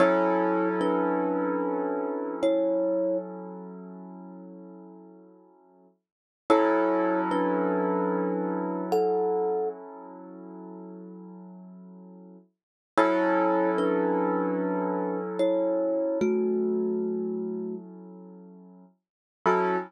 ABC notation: X:1
M:4/4
L:1/8
Q:"Swing 16ths" 1/4=74
K:F#phr
V:1 name="Kalimba"
[Ec]2 [DB]4 [Ec]2 | z8 | [Ec]2 [DB]4 [Af]2 | z8 |
[Ec]2 [DB]4 [Ec]2 | [A,F]4 z4 | F2 z6 |]
V:2 name="Acoustic Grand Piano"
[F,CEA]8- | [F,CEA]8 | [F,CEA]8- | [F,CEA]8 |
[F,CEA]8- | [F,CEA]8 | [F,CEA]2 z6 |]